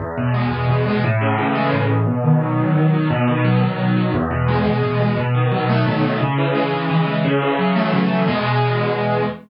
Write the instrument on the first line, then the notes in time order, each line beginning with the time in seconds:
acoustic grand piano
0.00 E2
0.18 B2
0.34 G#3
0.52 E2
0.68 B2
0.86 G#3
1.04 A2
1.21 C#3
1.38 E3
1.55 G#3
1.73 A2
1.90 C#3
2.07 B2
2.24 D#3
2.41 F#3
2.59 B2
2.75 D#3
2.93 F#3
3.10 B2
3.28 D#3
3.45 F#3
3.62 B2
3.79 D#3
3.96 F#3
4.14 E2
4.31 B2
4.48 G#3
4.66 E2
4.83 B2
5.00 G#3
5.17 B2
5.35 D#3
5.52 F#3
5.69 A3
5.86 B2
6.03 D#3
6.21 C#3
6.38 E3
6.55 G#3
6.73 C#3
6.89 E3
7.07 G#3
7.25 C#3
7.42 E3
7.59 F#3
7.76 A3
7.93 C#3
8.10 E3
8.28 E2 B2 G#3